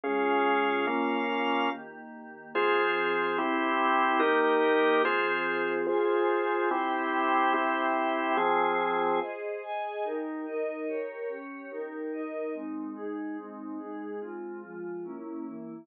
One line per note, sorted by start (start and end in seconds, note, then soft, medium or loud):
0.04 0.86 C#3 medium
0.04 0.86 G#3 medium
0.04 0.86 C#4 medium
0.04 0.86 F4 medium
0.04 0.86 G#4 medium
0.04 0.86 F5 medium
0.87 1.69 A#3 medium
0.87 1.70 A#3 medium
0.87 1.69 C#4 medium
0.87 1.70 C#4 medium
0.87 1.70 F4 medium
0.87 1.69 F5 medium
1.71 2.53 D#3 medium
1.71 2.53 A#3 medium
1.71 2.53 G4 medium
2.54 3.36 F3 medium
2.54 3.36 C4 medium
2.54 3.37 F4 medium
2.54 3.36 G#4 medium
2.54 3.37 G#4 loud
2.54 3.37 C5 medium
3.37 4.20 C4 medium
3.37 4.21 C4 medium
3.37 4.20 E4 medium
3.37 4.21 E4 medium
3.37 4.20 G4 medium
3.37 4.19 G4 medium
4.19 5.03 D#3 medium
4.19 5.03 A#3 medium
4.19 5.02 D#4 medium
4.19 5.02 G4 loud
4.19 5.03 G4 medium
4.19 5.02 A#4 medium
5.04 5.87 F3 medium
5.04 5.87 C4 medium
5.04 5.86 F4 medium
5.04 5.87 G#4 medium
5.04 5.86 G#4 medium
5.04 5.86 C5 medium
5.87 6.69 F4 medium
5.87 6.70 F4 loud
5.87 6.69 G#4 medium
5.87 6.69 C5 medium
5.87 6.70 C5 medium
5.87 6.70 G#5 medium
6.71 7.53 C4 medium
6.71 7.53 E4 medium
6.71 7.53 G4 medium
6.71 7.53 C5 loud
6.71 7.53 E5 medium
6.71 7.53 G5 medium
7.54 8.36 C4 medium
7.54 8.36 E4 medium
7.54 8.36 G4 medium
7.54 8.37 C5 medium
7.54 8.37 E5 medium
7.54 8.37 G5 medium
8.37 9.20 F3 medium
8.37 9.20 C4 medium
8.37 9.20 F4 medium
8.37 9.20 G#4 medium
8.37 9.20 C5 loud
8.37 9.20 G#5 medium
9.21 9.62 G#4 medium
9.21 9.62 C5 medium
9.21 9.62 D#5 medium
9.62 10.03 G#4 medium
9.62 10.03 D#5 medium
9.62 10.03 G#5 medium
10.04 10.45 D#4 medium
10.04 10.45 G4 medium
10.04 10.45 A#4 medium
10.46 10.87 D#4 medium
10.46 10.87 A#4 medium
10.46 10.87 D#5 medium
10.87 11.28 G4 medium
10.87 11.28 A#4 medium
10.87 11.28 C#5 medium
11.29 11.70 C#4 medium
11.29 11.70 G4 medium
11.29 11.70 C#5 medium
11.71 12.12 D#4 medium
11.71 12.12 G4 medium
11.71 12.12 A#4 medium
12.12 12.53 D#4 medium
12.12 12.54 A#4 medium
12.12 12.54 D#5 medium
12.54 12.95 G#3 medium
12.54 12.95 C4 medium
12.54 12.95 D#4 medium
12.96 13.37 G#3 medium
12.96 13.37 D#4 loud
12.96 13.37 G#4 medium
13.37 13.78 G#3 medium
13.37 13.79 C4 medium
13.37 13.78 D#4 medium
13.79 14.20 G#3 medium
13.79 14.20 D#4 medium
13.79 14.20 G#4 medium
14.21 14.62 G#3 medium
14.21 14.62 C4 medium
14.21 14.62 F4 medium
14.62 15.03 F3 medium
14.62 15.03 G#3 medium
14.62 15.03 F4 medium
15.04 15.45 A#3 medium
15.04 15.45 C#4 medium
15.04 15.45 E4 medium
15.46 15.87 E3 medium
15.46 15.87 A#3 medium
15.46 15.87 E4 medium